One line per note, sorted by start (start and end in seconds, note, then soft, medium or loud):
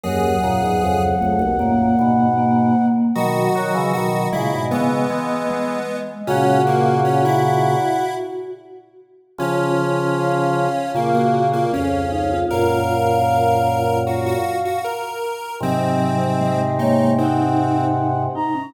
0.04 0.36 D#2 medium
0.04 0.36 F#2 medium
0.04 1.13 F#3 medium
0.04 1.03 G#4 medium
0.04 2.86 F#5 medium
0.43 0.62 F#2 medium
0.43 0.62 A#2 medium
0.63 0.81 E2 medium
0.63 0.81 G#2 medium
0.83 1.15 C#2 medium
0.83 1.15 F2 medium
1.21 1.41 C#2 medium
1.21 1.41 F2 medium
1.21 1.52 A3 medium
1.39 1.58 B1 medium
1.39 1.58 D#2 medium
1.59 1.93 F#2 medium
1.59 1.93 A#2 medium
1.59 2.27 A#3 medium
1.99 2.73 G#2 medium
1.99 2.73 B2 medium
2.38 3.11 A#3 medium
3.15 3.48 B2 medium
3.15 3.48 D#3 medium
3.15 4.10 F#3 medium
3.15 3.91 F#4 medium
3.15 5.94 D#5 medium
3.55 3.74 D#3 medium
3.55 3.74 F#3 medium
3.74 3.93 C#3 medium
3.74 3.93 E3 medium
3.93 4.27 B2 medium
3.93 4.27 D#3 medium
3.93 4.28 F#4 medium
4.32 4.53 A#2 medium
4.32 4.53 C#3 medium
4.32 4.68 G#3 medium
4.32 4.64 E4 medium
4.53 4.72 G#2 medium
4.53 4.72 B2 medium
4.71 5.05 C#3 medium
4.71 5.05 E3 medium
4.71 5.98 B3 medium
4.71 5.46 B3 medium
5.10 5.77 E3 medium
5.10 5.77 G#3 medium
5.49 6.20 G#3 medium
6.27 7.75 A#2 medium
6.27 7.75 C#3 medium
6.27 6.62 C#4 medium
6.27 8.50 F#4 medium
6.27 8.05 F#5 medium
6.67 7.00 A#3 medium
7.05 7.23 C#4 medium
7.25 8.14 E4 medium
9.38 10.67 C#3 medium
9.38 10.67 F3 medium
9.38 10.92 C#4 medium
9.38 10.68 F4 medium
10.17 10.89 F5 medium
10.94 11.64 A#2 medium
10.94 11.64 C#3 medium
10.94 11.14 A#3 medium
10.94 11.13 F4 medium
10.94 11.63 F5 medium
11.14 11.48 A#3 medium
11.14 11.33 F#4 medium
11.34 11.52 F#4 medium
11.53 11.72 A#3 medium
11.53 11.72 F4 medium
11.73 12.44 C#2 medium
11.73 12.44 F2 medium
11.73 12.07 C#4 medium
11.73 12.39 C#4 medium
11.73 12.10 F5 medium
12.12 12.30 D#4 medium
12.12 12.44 F5 medium
12.31 12.50 F4 medium
12.50 14.35 F#2 medium
12.50 14.35 A#2 medium
12.50 13.18 F4 medium
12.50 13.99 A#4 medium
12.50 13.81 F5 medium
13.29 14.57 F4 soft
14.06 14.25 F#4 medium
14.06 14.79 F5 medium
14.26 14.58 F#4 medium
14.65 14.84 F#4 medium
14.84 15.56 A#4 medium
15.60 18.27 G#2 medium
15.60 18.27 C3 medium
15.60 16.27 F#3 medium
15.60 16.61 C4 medium
15.60 16.26 D#5 medium
16.40 16.59 G#3 medium
16.40 16.78 D#5 medium
16.60 16.78 G#3 medium
16.79 17.17 A#3 medium
16.79 17.11 D#4 medium
16.79 17.12 C#5 medium
17.18 17.85 C4 medium
17.18 18.12 D#4 medium
17.18 18.23 F#5 medium
18.35 18.54 D#4 medium
18.35 18.70 A#5 medium
18.55 18.73 C#4 medium